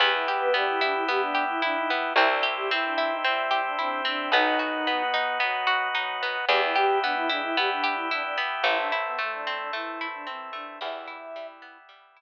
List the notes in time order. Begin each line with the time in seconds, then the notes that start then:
0.00 E2 B3 E4 G4
0.14 E4
0.26 G4
0.40 B3 B4
0.53 G3 B3 D4 G4
0.67 E4
0.81 D4 E4
0.95 E4
1.06 B2 B3 G4
1.21 D4
1.35 G4
1.49 E4
1.61 E3 D4 E4
1.77 D#4
1.90 B3
2.15 C2 C4 E4 G4
2.31 D4
2.43 G4
2.57 G3 G4
2.69 E3 C4 E4
2.85 D4
2.98 E4
3.10 D#4
3.24 G2 G3 C4 E4
3.51 G4
3.65 D4
3.77 C3 C4 D4 E4
4.05 C4 D4
4.31 B1 B3 D#4 F#4
4.59 F#4
4.73 D#3 D#4
4.87 B2 B3
5.14 D#4
5.40 F#2 F#3 B3
5.67 F#4
5.93 F#2 F#3 D#4
6.23 B3
6.48 E2 E3 B3 E4 G4
6.61 E4
6.75 E2 E3 G4
7.02 B2 B3 D4
7.16 E4
7.28 G#2 G#3 D4 E4
7.43 E4
7.57 G2 G3 B3 G4
7.72 D4
7.84 G4
7.96 E4
8.11 D4 E4
8.23 D4
8.38 B3
8.64 A1 A3 C4 E4
8.78 D4
8.92 E4
9.06 B2 B3
9.18 A2 A3
9.33 D4
9.47 C4
9.58 D4
9.73 E2 E3 A3 E4
10.01 E4
10.14 D4
10.26 E2 E3 C4
10.53 A3 D4
10.80 E2 E3 G3 B3 E4 E5
11.08 E4
11.36 G3
11.62 B3
11.89 G3
12.17 E4